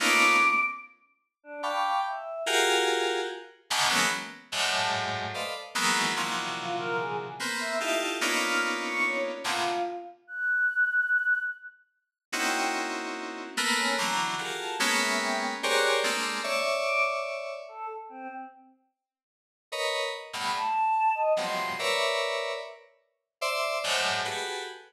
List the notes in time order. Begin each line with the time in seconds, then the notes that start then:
0.00 A3 A#3 B3 C#4 D#4 F4 D6
1.43 D4
1.63 F5 G5 A5 B5 C#6 D6
2.06 E5
2.46 F4 F#4 G4 G#4 A#4
3.70 G#2 A2 B2 C#3 D3 D#3
3.89 E3 F#3 G#3 A#3 B3 C#4
4.52 F#2 G#2 A2
4.72 A5
5.34 A4 B4 C5 D5 D#5 F5
5.75 D#3 E3 F#3 G#3 A#3 B3
6.16 A#2 C3 D3 E3 F3 F#3
6.58 F4
6.78 A#4
6.98 G#4
7.39 A#3 B3 C4
7.60 E5
7.80 D#4 E4 F4 G4 A4
8.21 A#3 B3 C#4 D4 D#4 F4
8.42 F6
8.85 C#6
9.04 C#5
9.44 A2 A#2 B2 C3 D3 F4
10.27 F#6
12.32 A#3 C4 C#4 D#4 E4 F#4 G5
13.57 A3 A#3 B3
13.76 C#4
13.97 D3 E3 F#3 A#5
14.38 F4 F#4 G4 G#4 A4 A#4
14.60 A5
14.79 G#3 A#3 B3 C#4
15.00 E5
15.19 G5
15.63 G4 G#4 A#4 C5 C#5 D5 F#6
16.03 G#3 A3 A#3 C4 D4
16.44 C#5 D5 E5
16.83 D6
17.68 A4
18.09 C4
19.72 A#4 B4 C#5 D#5
20.33 G2 A2 B2 B5
20.56 A5
21.15 D#5
21.35 F2 F#2 G2 A2 B2 C3 C6
21.79 A#4 B4 C#5 D5 E5
23.41 C5 D5 E5
23.84 F#2 G#2 A2 C5
24.25 F#4 G4 G#4 A4 B4